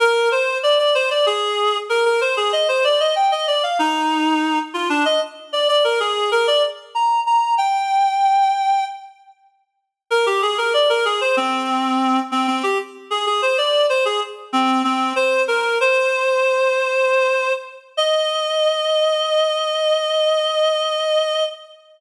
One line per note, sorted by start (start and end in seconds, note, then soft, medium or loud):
0.00 0.29 A#4 medium
0.32 0.58 C5 medium
0.63 0.78 D5 medium
0.79 0.94 D5 medium
0.95 1.10 C5 medium
1.11 1.26 D5 medium
1.26 1.77 G#4 medium
1.89 2.04 A#4 medium
2.05 2.20 A#4 medium
2.21 2.36 C5 medium
2.37 2.52 G#4 medium
2.53 2.68 D#5 medium
2.68 2.83 C5 medium
2.84 2.99 D5 medium
3.00 3.15 D#5 medium
3.16 3.31 G5 medium
3.32 3.47 D#5 medium
3.47 3.62 D5 medium
3.63 3.78 F5 medium
3.79 4.59 D#4 medium
4.74 4.89 F4 medium
4.89 5.04 D4 medium
5.05 5.20 D#5 medium
5.53 5.68 D5 medium
5.68 5.83 D5 medium
5.84 5.99 A#4 medium
6.00 6.30 G#4 medium
6.32 6.47 A#4 medium
6.47 6.62 D5 medium
6.95 7.20 A#5 medium
7.26 7.55 A#5 medium
7.58 8.85 G5 medium
10.11 10.26 A#4 medium
10.26 10.41 G4 medium
10.42 10.57 G#4 medium
10.58 10.73 A#4 medium
10.74 10.89 D5 medium
10.89 11.04 A#4 medium
11.05 11.20 G#4 medium
11.21 11.36 C5 medium
11.37 12.19 C4 medium
12.32 12.47 C4 medium
12.47 12.62 C4 medium
12.63 12.78 G4 medium
13.11 13.26 G#4 medium
13.26 13.41 G#4 medium
13.42 13.57 C5 medium
13.58 13.86 D5 medium
13.89 14.04 C5 medium
14.05 14.20 G#4 medium
14.53 14.82 C4 medium
14.84 15.13 C4 medium
15.16 15.42 C5 medium
15.48 15.78 A#4 medium
15.81 17.52 C5 medium
17.97 21.44 D#5 loud